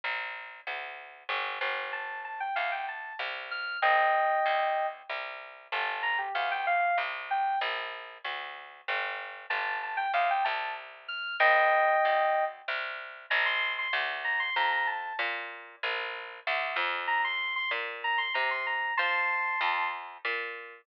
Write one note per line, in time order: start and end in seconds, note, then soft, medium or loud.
0.04 0.61 A#1 medium
0.67 1.24 D2 medium
1.29 1.59 G1 medium
1.61 2.49 G1 medium
1.93 2.21 A5 medium
2.25 2.40 A5 medium
2.40 2.55 G5 medium
2.56 3.13 D2 medium
2.56 2.71 F5 medium
2.72 2.87 G5 medium
2.89 3.15 A5 medium
3.19 3.77 C2 medium
3.51 3.79 F6 medium
3.82 4.39 A#1 medium
3.82 4.87 D#5 loud
3.82 4.87 G5 loud
4.46 5.03 D2 medium
5.09 5.68 C2 medium
5.72 6.29 G1 medium
5.72 6.03 A5 loud
6.03 6.18 A#5 loud
6.18 6.33 G4 loud
6.35 6.92 D2 medium
6.35 6.50 F5 loud
6.51 6.66 G5 loud
6.67 6.97 F5 loud
6.98 7.56 C2 medium
7.31 7.59 G5 loud
7.61 8.18 A#1 medium
8.24 8.81 D2 medium
8.88 9.46 G1 medium
9.50 10.07 G1 medium
9.50 9.78 A5 loud
9.83 9.98 A5 medium
9.97 10.12 G5 loud
10.14 10.44 D2 medium
10.14 10.29 F5 loud
10.30 10.45 G5 loud
10.44 11.35 C2 medium
10.44 10.71 A5 medium
11.08 11.36 F6 loud
11.40 11.97 A#1 medium
11.40 12.44 D#5 loud
11.40 12.44 G5 loud
12.05 12.62 D2 medium
12.68 13.26 C2 medium
13.30 13.88 A#1 loud
13.30 13.45 A#5 loud
13.46 13.73 C6 loud
13.79 13.94 C6 medium
13.93 14.50 D2 medium
14.24 14.39 A#5 loud
14.40 14.55 C6 loud
14.56 15.13 F2 medium
14.56 14.71 A#5 medium
14.72 14.87 A#5 medium
14.87 15.16 A5 medium
15.19 15.76 A#2 medium
15.83 16.40 A#1 medium
16.47 16.77 D2 medium
16.76 17.65 F2 loud
17.08 17.23 A#5 loud
17.24 17.54 C6 loud
17.56 17.71 C6 medium
17.71 18.28 A#2 medium
18.04 18.19 A#5 loud
18.18 18.33 C6 medium
18.34 18.92 C3 medium
18.34 18.49 A#5 medium
18.51 18.66 C6 loud
18.67 18.94 A#5 medium
18.97 19.56 F3 medium
18.97 19.88 A5 loud
18.97 19.88 C6 loud
19.61 20.18 F2 medium
20.25 20.82 A#2 medium